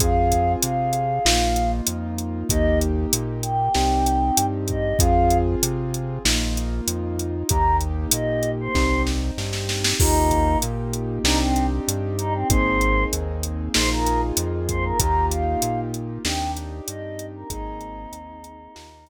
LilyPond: <<
  \new Staff \with { instrumentName = "Choir Aahs" } { \time 4/4 \key ees \major \tempo 4 = 96 f''4 f''2 r4 | ees''8 r4 g''2 ees''8 | f''8. r2. r16 | bes''8 r8 ees''8. c''8. r4. |
ees'4 r4 ees'16 c'8 r8. ees'16 c'16 | c''4 r4 c''16 bes'8 r8. c''16 bes'16 | bes''8 f''4 r8 g''8 r8 ees''8. bes'16 | ees'2.~ ees'8 r8 | }
  \new Staff \with { instrumentName = "Acoustic Grand Piano" } { \time 4/4 \key ees \major <c' f' aes'>2 <bes ees' f'>2 | <bes ees' g'>2 <c' ees' g'>2 | <c' f' aes'>2 <bes ees' f'>2 | <bes ees' g'>2 <c' ees' g'>2 |
<bes ees' f' g'>2 <c' d' ees' g'>2 | <bes c' ees' aes'>2 <bes ees' f' aes'>2 | <bes ees' f' g'>2 <c' d' ees' g'>2 | <bes c' ees' aes'>2 <bes ees' f' g'>2 | }
  \new Staff \with { instrumentName = "Synth Bass 1" } { \clef bass \time 4/4 \key ees \major f,4 c4 bes,,4 f,4 | ees,4 bes,4 c,4 g,4 | f,4 c4 bes,,4 f,4 | ees,4 bes,4 c,4 g,4 |
ees,4 bes,4 c,4 g,4 | aes,,4 ees,4 bes,,4 f,4 | ees,4 bes,4 ees,4 g,4 | aes,,4 ees,4 ees,4 r4 | }
  \new DrumStaff \with { instrumentName = "Drums" } \drummode { \time 4/4 <hh bd>8 <hh bd>8 hh8 hh8 sn8 hh8 hh8 hh8 | <hh bd>8 hh8 hh8 hh8 sn8 hh8 hh8 <hh bd>8 | <hh bd>8 hh8 hh8 hh8 sn8 hh8 hh8 hh8 | <hh bd>8 hh8 hh8 hh8 <bd sn>8 sn8 sn16 sn16 sn16 sn16 |
<cymc bd>8 <hh bd>8 hh8 hh8 sn8 hh8 hh8 hh8 | <hh bd>8 hh8 hh8 hh8 sn8 hh8 hh8 <hh bd>8 | <hh bd>8 hh8 hh8 hh8 sn8 hh8 hh8 hh8 | <hh bd>8 hh8 hh8 hh8 sn8 hh8 r4 | }
>>